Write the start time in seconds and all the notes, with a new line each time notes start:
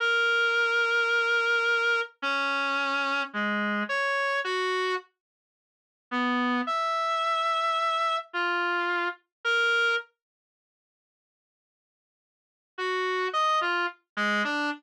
0.00 A#4
2.22 C#4
3.33 G#3
3.89 C#5
4.44 F#4
6.11 B3
6.67 E5
8.33 F4
9.44 A#4
12.78 F#4
13.33 D#5
13.61 F4
14.17 G#3
14.44 D4